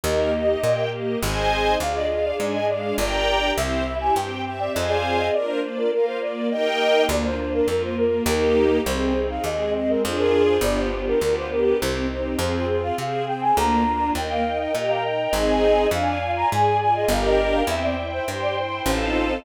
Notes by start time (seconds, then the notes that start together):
0.04 D#2 A#3 D#4 G4 A#4 D#5
0.33 D#5
0.63 A#2 A#3 G4 A#4 G5
0.92 D#5
1.21 G#1 C4 D#4 G#4 C5 D#5 G#5
1.79 D2 D4 F4 G#4 D5 F5
1.95 D#5
2.10 F5
2.24 D5
2.39 G#2 G#3 D4 G#4 D5 G#5
2.54 D#5
2.68 D5 F5
2.97 G1 D4 G4 A#4 D5 G5 A#5
3.57 C2 C4 E4 G4 C5 E5
3.86 E5
4.01 G#5
4.15 G2 C4 G4 C5 G5
4.45 E5 G5
4.60 D5
4.74 F2 C4 F4 G#4 C5 D#5 F5 G#5
4.89 D5
5.19 D#5
5.33 A#3 D4 F4 A#4 D5
5.48 C5
5.63 D5
5.77 A#4
5.92 A#3 F4 A#4 F5
6.06 C5
6.21 D5
6.51 A#3 D#4 G4 A#4 D#5 G5
7.09 D2 A#3 D4 F4 D5
7.25 C5
7.39 D4
7.54 A#4
7.67 F2 A#3 F4 A#4
7.83 C5
7.98 A#3 A#4
8.26 D#2 A#3 D#4 G4 A#4
8.86 C2 C4 D#4 G#4 C5
9.16 D#4
9.30 F5
9.44 D#2 G#3 C4 G#4 D#5
9.74 C4 D#5
9.89 A#4
10.02 F2 D4 F4 G#4 C5
10.18 A#4
10.48 C5
10.61 G1 B3 D4 F4 G4 D5
10.78 C5
10.92 D4
11.07 A#4
11.20 D2 B3 D4 F4 G4 A#4 B4
11.36 C5
11.51 G4 A#4
11.80 C2 C4 D#4 G4 C5
12.10 D#4
12.39 F2 C4 F4 G#4 C5
12.69 F4
12.83 F5
12.98 C3 C4 G#4 C5 F5
13.27 C4 G5
13.42 G#5
13.56 D2 A#3 D4 F4 A#5
13.86 D4
14.15 D#2 A#3 A#4 D#5 G5
14.30 F5
14.45 D#4
14.60 D#5
14.74 A#2 G4 A#4 D#5 G5 A#5
14.89 F5
15.04 D#4 D#5
15.33 G#1 C4 D#4 G#4 C5 D#5 G#5
15.91 F2 D4 D5 F5 G#5
16.22 F4
16.36 A#5
16.51 G#2 G#4 D5 G#5
16.80 F4 G#5
16.95 D#5
17.08 G1 D4 G4 A#4 D5 F5 G5 A#5
17.24 D#5
17.54 F5
17.67 E2 C4 C5 E5 G5
17.83 D5
17.98 E4
18.13 C5
18.27 G2 G4 C5 G5 C6
18.42 D5
18.57 E4 C5
18.85 A1 C4 D#4 F4 A4 C5 D#5 F5 A5